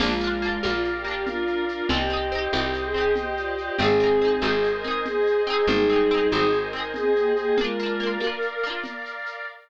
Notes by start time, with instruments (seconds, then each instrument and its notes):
0.00 electric bass (finger) A#1, choir aahs G#3 F4, pizzicato strings A#3 D4, violin F4, pad 5 (bowed) A#4 D5 F5, crash, low conga, shaker
0.06 pizzicato strings F4
0.21 pizzicato strings A#3 D4, shaker
0.27 pizzicato strings F4
0.42 pizzicato strings A#3 D4, shaker
0.49 pizzicato strings F4
0.63 electric bass (finger) A#1, pizzicato strings A#3 D4, violin F4, high conga, shaker
0.70 pizzicato strings F4
0.84 shaker
0.95 violin G4
1.04 pizzicato strings A#3 D4, violin G4, shaker
1.11 pizzicato strings F4
1.26 choir aahs D4 A#4, violin F4, low conga, shaker
1.47 choir aahs D4 A#4, shaker
1.68 choir aahs D4 A#4, violin F4, shaker
1.89 electric bass (finger) C2, pizzicato strings C4, choir aahs G4 D#5, violin G4, pad 5 (bowed) C5 D#5 G5, low conga, shaker
1.94 pizzicato strings D#4 G4
2.10 pizzicato strings C4 D#4, shaker
2.16 pizzicato strings G4
2.32 pizzicato strings C4 D#4, shaker
2.38 pizzicato strings G4
2.52 electric bass (finger) C2, pizzicato strings C4 D#4, violin G4, high conga, shaker
2.59 pizzicato strings G4
2.73 shaker
2.84 violin G#4
2.94 pizzicato strings C4 D#4, violin G#4, shaker
3.01 pizzicato strings G4
3.16 choir aahs G4 D#5, violin G4, low conga, shaker
3.37 choir aahs F4 D5, shaker
3.58 choir aahs F4 D5, violin G4, shaker
3.78 electric bass (finger) G#1, pizzicato strings C4 D#4, choir aahs C4 G#4, violin G#4, pad 5 (bowed) C5 D#5 G#5, low conga, shaker
3.85 pizzicato strings G#4
4.00 pizzicato strings C4 D#4, shaker
4.07 pizzicato strings G#4
4.21 pizzicato strings C4 D#4, shaker
4.28 pizzicato strings G#4
4.42 electric bass (finger) G#1, pizzicato strings C4 D#4, violin G#4, high conga, shaker
4.48 pizzicato strings G#4
4.63 shaker
4.74 violin A#4
4.84 pizzicato strings C4 D#4, violin A#4, shaker
4.91 pizzicato strings G#4
5.05 violin G#4, low conga, shaker
5.26 shaker
5.47 pizzicato strings C4 D#4, violin G#4, shaker
5.53 pizzicato strings G#4
5.67 electric bass (finger) G#1, choir aahs G3 D#4, violin G#4, pad 5 (bowed) C5 D#5 G#5, low conga, shaker
5.89 pizzicato strings C4 D#4, shaker
5.96 pizzicato strings G#4
6.10 pizzicato strings C4, shaker
6.14 pizzicato strings D#4 G#4
6.32 electric bass (finger) G#1, pizzicato strings C4, violin G#4, high conga, shaker
6.36 pizzicato strings D#4 G#4
6.53 shaker
6.63 violin A#4
6.73 pizzicato strings C4 D#4, violin A#4, shaker
6.80 pizzicato strings G#4
6.94 choir aahs C4 G#4, violin G#4, low conga, shaker
7.16 choir aahs A#3 G4, shaker
7.36 choir aahs A#3 G4, violin G#4, shaker
7.58 choir aahs G#3 F4, pizzicato strings A#3 D4, violin A#4, pad 5 (bowed) A#4 D5 F5, low conga, shaker
7.64 pizzicato strings F4
7.79 pizzicato strings A#3, shaker
7.83 pizzicato strings D4 F4
8.00 pizzicato strings A#3 D4, shaker
8.06 pizzicato strings F4
8.20 pizzicato strings A#3 D4, high conga, shaker
8.27 pizzicato strings F4
8.42 shaker
8.63 pizzicato strings A#3 D4, shaker
8.70 pizzicato strings F4
8.84 low conga, shaker
9.05 shaker
9.26 shaker